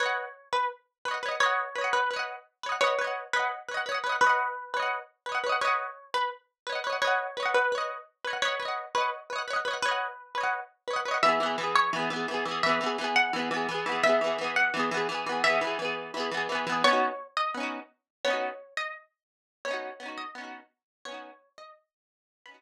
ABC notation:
X:1
M:4/4
L:1/8
Q:"Swing 16ths" 1/4=171
K:B
V:1 name="Harpsichord"
c3 B z4 | c3 B z4 | c3 B z4 | B4 z4 |
c3 B z4 | c3 B z4 | c3 B z4 | B4 z4 |
[K:E] e3 c z4 | e3 f z4 | e3 f z4 | e5 z3 |
[K:B] c3 d z4 | c3 d z4 | c3 d z4 | c3 d z4 |
b4 z4 |]
V:2 name="Harpsichord"
[Bdf]6 [Bcdf] [Bcdf] | [Bdf]2 [Bcdf]2 [Bcdf]3 [Bcdf] | [Bdf] [Bcdf]2 [cdf]2 [Bcdf] [Bcdf] [Bcdf] | [cdf]3 [Bcdf]3 [Bcdf] [Bcdf] |
[Bdf]6 [Bcdf] [Bcdf] | [Bdf]2 [Bcdf]2 [Bcdf]3 [Bcdf] | [Bdf] [Bcdf]2 [cdf]2 [Bcdf] [Bcdf] [Bcdf] | [cdf]3 [Bcdf]3 [Bcdf] [Bcdf] |
[K:E] [E,B,G] [E,B,G] [E,B,G]2 [E,B,G] [E,B,G] [E,B,G] [E,B,G] | [E,B,G] [E,B,G] [E,B,G]2 [E,B,G] [E,B,G] [E,B,G] [E,B,G] | [E,B,G] [E,B,G] [E,B,G]2 [E,B,G] [E,B,G] [E,B,G] [E,B,G] | [E,B,G] [E,B,G] [E,B,G]2 [E,B,G] [E,B,G] [E,B,G] [E,B,G] |
[K:B] [B,CDF]4 [B,CDF]4 | [B,CDF]8 | [B,CDF]2 [B,CDF]2 [B,CDF]4 | [B,CDF]8 |
[B,CDF]3 z5 |]